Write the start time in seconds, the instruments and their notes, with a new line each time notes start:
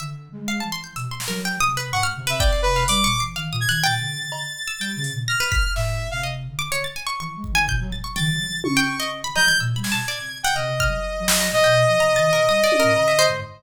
0.00 flute D3, pizzicato strings E5
0.32 flute G#3
0.48 pizzicato strings F5
0.60 flute E3, pizzicato strings A5
0.72 pizzicato strings C6
0.84 pizzicato strings G6
0.96 flute B2, pizzicato strings E6, closed hi-hat
1.11 pizzicato strings C6
1.20 snare
1.28 flute F#3, pizzicato strings A#4
1.45 pizzicato strings G5
1.60 flute C3, pizzicato strings D#6
1.77 pizzicato strings B4
1.92 flute G#2, lead 2 (sawtooth) F#5, pizzicato strings C#6
2.03 pizzicato strings F6
2.16 flute C3
2.27 pizzicato strings B4, lead 2 (sawtooth) E5
2.39 lead 2 (sawtooth) D5, pizzicato strings G5, kick
2.53 pizzicato strings C7
2.62 lead 2 (sawtooth) B4
2.76 pizzicato strings F5
2.88 flute G3, pizzicato strings D5, lead 2 (sawtooth) D6, closed hi-hat
3.04 flute A#2, pizzicato strings C#6
3.20 flute E3, pizzicato strings C7
3.36 flute D#3, pizzicato strings F5
3.52 flute A#2, pizzicato strings D#6
3.60 lead 2 (sawtooth) G#6
3.68 flute D#3, pizzicato strings F#6
3.83 flute A#2, pizzicato strings G5, lead 2 (sawtooth) A6
4.00 flute D3
4.16 flute D3
4.32 cowbell
4.67 pizzicato strings E6
4.80 flute G3, pizzicato strings G5
4.96 flute C#3
5.04 closed hi-hat
5.12 flute A#2
5.28 lead 2 (sawtooth) F6, pizzicato strings A#6
5.40 pizzicato strings B4
5.52 pizzicato strings B6, kick
5.75 flute A2, lead 2 (sawtooth) E5, snare
6.11 flute C3, lead 2 (sawtooth) F5
6.23 pizzicato strings D#5
6.48 flute D3
6.59 pizzicato strings D6
6.72 pizzicato strings C#5
6.84 pizzicato strings A6
6.96 pizzicato strings G#5
7.07 pizzicato strings C#6
7.20 flute E3, pizzicato strings C#6
7.36 flute G#3
7.44 kick
7.52 flute D#3, pizzicato strings G#5
7.68 flute A#2, pizzicato strings G6, kick
7.80 flute F#3
7.92 flute A#2, pizzicato strings A6
8.04 pizzicato strings C#6
8.16 flute D#3, pizzicato strings G5, lead 2 (sawtooth) A6, floor tom
8.32 flute F#3
8.48 flute E3
8.64 flute C#3, lead 2 (sawtooth) C#6, high tom
8.77 pizzicato strings G5
9.00 pizzicato strings D#5
9.24 pizzicato strings B5
9.36 flute F#3, pizzicato strings D#5, lead 2 (sawtooth) G6, cowbell
9.48 flute E3, pizzicato strings G#6
9.60 flute A#2, pizzicato strings E6
9.76 flute G3, pizzicato strings B5
9.83 lead 2 (sawtooth) G#6, snare
9.92 flute B2, pizzicato strings A5
10.08 flute B2, pizzicato strings D5
10.20 flute C3
10.43 pizzicato strings F#5, lead 2 (sawtooth) G5
10.55 flute C3, lead 2 (sawtooth) D#5, pizzicato strings F6
10.80 pizzicato strings F6, kick
10.88 flute F#3
11.20 flute F#3
11.28 snare
11.40 pizzicato strings D#5
11.52 flute B2, lead 2 (sawtooth) D#5
11.64 pizzicato strings G5
11.88 flute F3
12.00 flute C3, pizzicato strings A#5
12.16 flute D#3, pizzicato strings A6
12.32 flute B2, pizzicato strings A#4
12.48 flute G3, pizzicato strings D#6
12.64 pizzicato strings D5
12.72 high tom
12.80 flute A2, pizzicato strings A#4
12.96 flute D3, cowbell
13.08 flute D3, pizzicato strings E5
13.19 pizzicato strings C5, cowbell
13.28 flute G#2